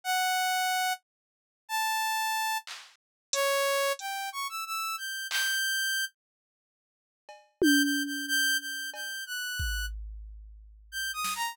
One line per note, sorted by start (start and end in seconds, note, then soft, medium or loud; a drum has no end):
0.04 0.93 F#5 loud
1.69 2.58 A5 loud
2.67 clap medium
3.33 3.92 C#5 loud
3.33 closed hi-hat loud
3.99 4.29 G5 medium
3.99 closed hi-hat medium
4.32 4.47 C#6 medium
4.49 4.64 E6 medium
4.66 4.96 E6 medium
4.98 5.27 G6 medium
5.30 6.05 G6 loud
5.30 clap medium
7.29 cowbell medium
7.62 7.82 G6 loud
7.62 high tom loud
7.83 8.03 G6 medium
8.06 8.26 G6 medium
8.27 8.57 G6 loud
8.60 8.90 G6 medium
8.94 9.24 G6 medium
8.94 cowbell medium
9.26 9.86 F#6 medium
9.59 kick medium
10.92 11.11 G6 medium
11.13 11.33 D#6 medium
11.24 snare medium
11.35 11.55 A#5 medium